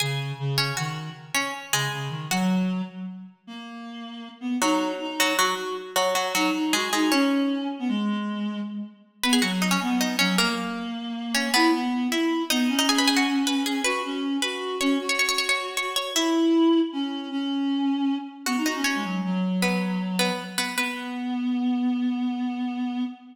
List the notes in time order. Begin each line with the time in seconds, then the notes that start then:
0.00 C#3 G#4 G#5
0.39 C#3
0.58 C#4 C#5
0.77 D#3 F#4 F#5
1.34 C#4 C#5
1.72 C#3 G#3 G#4
1.91 C#3
2.09 D#3
2.30 F#3 F#4 F#5
3.47 A#3
4.41 B3
4.61 F#3 D#4 F#4
5.00 D#4
5.20 F#3 F#4
5.39 F#3 F#4
5.96 F#3 F#4
6.15 F#3 F#4
6.35 F#3 D#4 F#4
6.54 D#4
6.73 G#3 F#4 G#4
6.93 G#3 D#4 G#4
7.11 C#4 C#5
7.79 B3
7.88 G#3
9.23 B3 B4 B5
9.33 G#4 G#5
9.42 F#3 F#4 F#5
9.62 D#4 D#5
9.71 C#4 C#5
9.82 B3
10.01 D#4 D#5
10.19 F#3 C#4 C#5
10.38 A#3 A#4
11.34 C#4 C#5
11.54 B3 E4 B4
11.74 B3
12.12 E4 E5
12.50 B3 D#4 D#5
12.69 C#4
12.79 D#4 D#5
12.89 G#4 G#5
12.98 B4 B5
13.08 G#4 G#5
13.17 F#4 F#5
13.47 B4 B5
13.66 G#4 G#5
13.84 F#4 B4 B5
14.04 C#4
14.42 F#4 B4 B5
14.80 C#4 C#5 C#6
15.00 F#4
15.09 C#5 C#6
15.19 C#5 C#6
15.29 C#5 C#6
15.38 C#5 C#6
15.49 C#5 C#6
15.77 C#5 C#6
15.96 C#5 C#6
16.15 E4 E5
16.92 C#4
17.31 C#4
18.46 B3 F#4 F#5
18.57 D#4
18.66 D#4 F#4 D#5
18.75 C#4
18.84 C#4 C#5
18.95 G#3
19.04 F#3
19.25 F#3
19.62 B3 B4
20.19 B3 B4
20.58 B3 B4
20.76 B3 B4